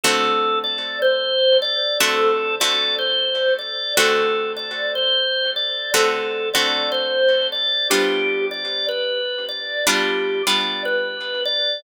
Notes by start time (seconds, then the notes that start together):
0.03 D3 A3 C4 F#4 A4
0.64 D5
1.02 C5
1.62 D5
2.00 D3 A3 C4 F#4 A4
2.60 D3 A3 C4 F#4 D5
2.99 C5
3.59 D5
3.97 D3 A3 C4 F#4 A4
4.57 D5
4.95 C5
5.56 D5
5.94 D3 A3 C4 F#4 A4
6.53 D3 A3 C4 F#4 D5
6.92 C5
7.52 D5
7.90 G3 B3 D4 F4 G4
8.51 D5
8.89 B4
9.49 D5
9.87 G3 B3 D4 F4 G4
10.47 G3 B3 D4 F4 D5
10.85 B4
11.45 D5